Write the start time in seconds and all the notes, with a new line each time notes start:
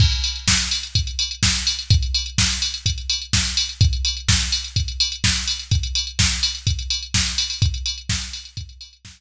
0.00 kick, crash
0.12 closed hi-hat
0.24 open hi-hat
0.36 closed hi-hat
0.48 kick, snare
0.60 closed hi-hat
0.71 open hi-hat
0.83 closed hi-hat
0.95 kick, closed hi-hat
1.07 closed hi-hat
1.19 open hi-hat
1.31 closed hi-hat
1.43 kick, snare
1.55 closed hi-hat
1.67 open hi-hat
1.79 closed hi-hat
1.90 kick, closed hi-hat
2.03 closed hi-hat
2.14 open hi-hat
2.26 closed hi-hat
2.38 kick, snare
2.50 closed hi-hat
2.62 open hi-hat
2.74 closed hi-hat
2.86 kick, closed hi-hat
2.98 closed hi-hat
3.10 open hi-hat
3.22 closed hi-hat
3.33 kick, snare
3.45 closed hi-hat
3.57 open hi-hat
3.69 closed hi-hat
3.81 kick, closed hi-hat
3.93 closed hi-hat
4.05 open hi-hat
4.17 closed hi-hat
4.28 kick, snare
4.41 closed hi-hat
4.52 open hi-hat
4.64 closed hi-hat
4.76 kick, closed hi-hat
4.88 closed hi-hat
5.00 open hi-hat
5.12 closed hi-hat
5.24 kick, snare
5.36 closed hi-hat
5.48 open hi-hat
5.59 closed hi-hat
5.71 kick, closed hi-hat
5.83 closed hi-hat
5.95 open hi-hat
6.07 closed hi-hat
6.19 kick, snare
6.31 closed hi-hat
6.43 open hi-hat
6.55 closed hi-hat
6.67 kick, closed hi-hat
6.79 closed hi-hat
6.90 open hi-hat
7.03 closed hi-hat
7.14 kick, snare
7.26 closed hi-hat
7.38 open hi-hat
7.50 open hi-hat
7.62 kick, closed hi-hat
7.74 closed hi-hat
7.86 open hi-hat
7.98 closed hi-hat
8.09 kick, snare
8.21 closed hi-hat
8.33 open hi-hat
8.45 closed hi-hat
8.57 kick, closed hi-hat
8.69 closed hi-hat
8.81 open hi-hat
8.93 closed hi-hat
9.05 kick, snare
9.17 closed hi-hat